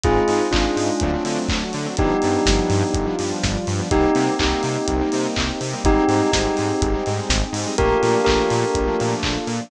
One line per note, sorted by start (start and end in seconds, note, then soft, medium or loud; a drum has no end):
0.04 0.19 G#1 loud
0.04 0.23 G#3 medium
0.04 0.52 G#3 medium
0.04 0.23 C4 medium
0.04 0.54 C4 medium
0.04 0.23 D#4 medium
0.04 0.52 D#4 medium
0.04 0.44 F4 medium
0.04 0.44 G#4 medium
0.04 kick loud
0.04 closed hi-hat loud
0.28 0.41 G#2 loud
0.28 0.48 G#3 medium
0.28 0.48 C4 medium
0.28 0.48 D#4 medium
0.28 open hi-hat medium
0.52 0.66 G#1 medium
0.52 1.00 G#3 medium
0.52 0.91 G#3 medium
0.52 0.91 C4 medium
0.52 1.40 D4 medium
0.52 1.00 D#4 medium
0.52 0.91 D#4 medium
0.52 1.40 F4 medium
0.52 1.00 G#4 medium
0.52 kick medium
0.52 clap loud
0.76 0.90 G#2 medium
0.76 open hi-hat medium
1.00 1.16 D2 loud
1.00 1.11 F#3 medium
1.00 1.47 F#3 medium
1.00 1.11 A3 medium
1.00 1.47 A3 medium
1.00 1.11 C4 medium
1.00 1.50 C4 medium
1.00 1.11 D4 medium
1.00 1.47 D4 medium
1.00 kick loud
1.00 closed hi-hat loud
1.13 1.23 F#3 medium
1.13 1.23 A3 medium
1.13 1.23 C4 medium
1.13 1.23 D4 medium
1.25 1.38 D3 loud
1.25 1.64 F#3 medium
1.25 1.64 A3 medium
1.25 1.64 C4 medium
1.25 1.64 D4 medium
1.25 open hi-hat medium
1.48 1.63 D2 medium
1.48 1.95 F#3 medium
1.48 1.95 A3 medium
1.48 1.95 D4 medium
1.48 1.95 F#4 medium
1.48 kick loud
1.48 clap loud
1.73 1.87 D3 loud
1.73 open hi-hat medium
1.86 1.95 F#3 medium
1.86 1.95 A3 medium
1.86 1.95 C4 medium
1.86 1.95 D4 medium
1.97 2.13 G1 loud
1.97 2.92 F3 medium
1.97 2.17 F3 medium
1.97 2.92 G3 medium
1.97 2.17 G3 medium
1.97 2.93 B3 medium
1.97 2.17 B3 medium
1.97 2.92 D4 medium
1.97 2.17 D4 medium
1.97 3.11 D#4 medium
1.97 3.11 G4 medium
1.97 kick loud
1.97 closed hi-hat loud
2.22 2.37 G2 medium
2.22 2.42 F3 medium
2.22 2.42 G3 medium
2.22 2.42 B3 medium
2.22 2.42 D4 medium
2.22 open hi-hat medium
2.46 2.60 G1 loud
2.46 2.85 F3 medium
2.46 2.85 G3 medium
2.46 2.85 B3 medium
2.46 2.85 D4 medium
2.46 kick loud
2.46 snare loud
2.70 2.83 G2 loud
2.70 open hi-hat medium
2.93 3.08 G1 loud
2.93 3.89 F3 medium
2.93 3.89 G3 medium
2.93 3.89 D4 medium
2.93 3.89 F4 medium
2.93 kick loud
2.93 closed hi-hat loud
3.06 3.16 F3 medium
3.06 3.16 G3 medium
3.06 3.16 B3 medium
3.06 3.16 D4 medium
3.19 3.32 G2 medium
3.19 3.58 F3 medium
3.19 3.58 G3 medium
3.19 3.58 B3 medium
3.19 3.58 D4 medium
3.19 open hi-hat medium
3.43 3.57 G1 loud
3.43 kick medium
3.43 snare loud
3.67 3.81 G2 loud
3.67 open hi-hat medium
3.79 3.88 F3 medium
3.79 3.88 G3 medium
3.79 3.88 B3 medium
3.79 3.88 D4 medium
3.91 4.06 C2 loud
3.91 4.11 G3 medium
3.91 5.82 A#3 medium
3.91 4.11 A#3 medium
3.91 5.82 C4 medium
3.91 4.11 C4 medium
3.91 5.82 D#4 medium
3.91 4.11 D#4 medium
3.91 4.34 D#4 medium
3.91 5.82 G4 medium
3.91 4.34 G4 medium
3.91 kick loud
3.91 closed hi-hat loud
4.15 4.29 C3 loud
4.15 4.35 G3 medium
4.15 4.35 A#3 medium
4.15 4.35 C4 medium
4.15 4.35 D#4 medium
4.15 open hi-hat medium
4.39 4.54 C2 loud
4.39 4.78 G3 medium
4.39 4.78 A#3 medium
4.39 4.78 C4 medium
4.39 4.78 D#4 medium
4.39 5.21 D#4 medium
4.39 5.21 G4 medium
4.39 kick medium
4.39 clap loud
4.63 4.77 C3 loud
4.63 open hi-hat medium
4.88 5.02 C2 loud
4.88 kick medium
4.88 closed hi-hat loud
5.01 5.10 G3 medium
5.01 5.10 A#3 medium
5.01 5.10 C4 medium
5.01 5.10 D#4 medium
5.12 5.27 C3 loud
5.12 5.51 G3 medium
5.12 5.51 A#3 medium
5.12 5.51 C4 medium
5.12 5.51 D#4 medium
5.12 open hi-hat medium
5.36 5.51 C2 loud
5.36 kick medium
5.36 clap loud
5.61 5.74 C3 medium
5.61 open hi-hat medium
5.73 5.83 G3 medium
5.73 5.83 A#3 medium
5.73 5.83 C4 medium
5.73 5.83 D#4 medium
5.84 5.97 G#1 loud
5.84 6.04 G3 medium
5.84 6.04 G#3 medium
5.84 7.75 C4 medium
5.84 6.04 C4 medium
5.84 7.75 D#4 medium
5.84 6.04 D#4 medium
5.84 6.31 D#4 medium
5.84 7.75 G4 medium
5.84 6.31 G4 medium
5.84 7.75 G#4 medium
5.84 kick loud
5.84 closed hi-hat loud
6.08 6.22 G#2 loud
6.08 6.29 G3 medium
6.08 6.29 G#3 medium
6.08 6.29 C4 medium
6.08 6.29 D#4 medium
6.08 open hi-hat medium
6.32 6.48 G#1 loud
6.32 6.72 G3 medium
6.32 6.72 G#3 medium
6.32 6.72 C4 medium
6.32 7.11 D#4 medium
6.32 6.72 D#4 medium
6.32 7.11 G4 medium
6.32 kick medium
6.32 snare loud
6.57 6.72 G#2 medium
6.57 open hi-hat medium
6.81 6.95 G#1 loud
6.81 kick loud
6.81 closed hi-hat loud
6.94 7.04 G3 medium
6.94 7.04 G#3 medium
6.94 7.04 C4 medium
6.94 7.04 D#4 medium
7.06 7.20 G#2 medium
7.06 7.44 G3 medium
7.06 7.44 G#3 medium
7.06 7.44 C4 medium
7.06 7.44 D#4 medium
7.06 open hi-hat medium
7.29 7.43 G#1 loud
7.29 kick medium
7.29 snare loud
7.53 7.66 G#2 loud
7.53 open hi-hat loud
7.66 7.76 G3 medium
7.66 7.76 G#3 medium
7.66 7.76 C4 medium
7.66 7.76 D#4 medium
7.78 7.93 A#1 loud
7.78 7.97 F3 medium
7.78 7.97 A3 medium
7.78 7.97 A#3 medium
7.78 9.70 A#3 medium
7.78 7.97 D4 medium
7.78 9.70 D4 medium
7.78 9.70 F4 medium
7.78 8.20 G4 medium
7.78 9.70 A4 medium
7.78 8.20 A#4 medium
7.78 kick loud
7.78 closed hi-hat loud
8.03 8.16 A#2 loud
8.03 8.22 F3 medium
8.03 8.22 A3 medium
8.03 8.22 A#3 medium
8.03 8.22 D4 medium
8.03 open hi-hat medium
8.25 8.40 A#1 medium
8.25 8.66 F3 medium
8.25 8.66 A3 medium
8.25 8.66 A#3 medium
8.25 8.66 D4 medium
8.25 9.12 G4 medium
8.25 9.12 A#4 medium
8.25 kick medium
8.25 clap loud
8.50 8.64 A#2 loud
8.50 open hi-hat medium
8.75 8.89 A#1 medium
8.75 kick loud
8.75 closed hi-hat loud
8.87 8.97 F3 medium
8.87 8.97 A3 medium
8.87 8.97 A#3 medium
8.87 8.97 D4 medium
8.99 9.14 A#2 loud
8.99 9.38 F3 medium
8.99 9.38 A3 medium
8.99 9.38 A#3 medium
8.99 9.38 D4 medium
8.99 open hi-hat medium
9.23 9.37 A#1 medium
9.23 kick medium
9.23 clap loud
9.47 9.60 A#2 loud
9.47 open hi-hat medium
9.60 9.70 F3 medium
9.60 9.70 A3 medium
9.60 9.70 A#3 medium
9.60 9.70 D4 medium